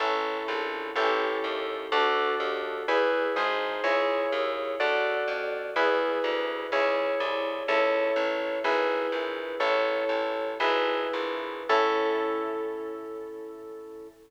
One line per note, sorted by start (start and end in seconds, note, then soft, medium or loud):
0.00 0.43 A1 loud
0.00 0.94 C#4 medium
0.00 0.94 E4 medium
0.00 0.94 A4 medium
0.48 0.91 A#1 loud
0.96 1.39 A1 loud
0.96 1.90 C#4 medium
0.96 1.90 E4 medium
0.96 1.90 G4 medium
0.96 1.90 A4 medium
1.44 1.87 D#2 medium
1.92 2.35 D2 loud
1.92 2.86 D4 medium
1.92 2.86 F#4 medium
1.92 2.86 A4 medium
2.40 2.83 D#2 medium
2.88 3.32 E2 loud
2.88 3.35 E4 medium
2.88 3.35 G#4 medium
2.88 3.35 B4 medium
3.36 3.81 G#1 loud
3.36 3.83 D#4 medium
3.36 3.83 G#4 medium
3.36 3.83 C5 medium
3.84 4.27 C#2 loud
3.84 4.78 E4 medium
3.84 4.78 G#4 medium
3.84 4.78 C#5 medium
4.32 4.75 D#2 medium
4.80 5.24 D2 loud
4.80 5.74 F#4 medium
4.80 5.74 A4 medium
4.80 5.74 D5 medium
5.28 5.71 F2 medium
5.76 6.19 E2 loud
5.76 6.70 E4 medium
5.76 6.70 G#4 medium
5.76 6.70 B4 medium
6.24 6.67 D2 medium
6.72 7.15 C#2 loud
6.72 7.66 E4 medium
6.72 7.66 G#4 medium
6.72 7.66 C#5 medium
7.20 7.63 C2 loud
7.68 8.12 C#2 loud
7.68 8.62 E4 medium
7.68 8.62 A4 medium
7.68 8.62 C#5 medium
8.16 8.59 A1 loud
8.64 9.07 G#1 loud
8.64 9.58 E4 medium
8.64 9.58 G#4 medium
8.64 9.58 B4 medium
9.12 9.55 A#1 medium
9.60 10.04 A1 loud
9.60 10.58 E4 medium
9.60 10.58 A4 medium
9.60 10.58 C#5 medium
10.09 10.55 A1 medium
10.60 11.08 G#1 loud
10.60 11.67 E4 medium
10.60 11.67 G#4 medium
10.60 11.67 B4 medium
11.13 11.63 A#1 medium
11.69 14.08 A2 loud
11.69 14.08 C#4 medium
11.69 14.08 E4 loud
11.69 14.08 A4 loud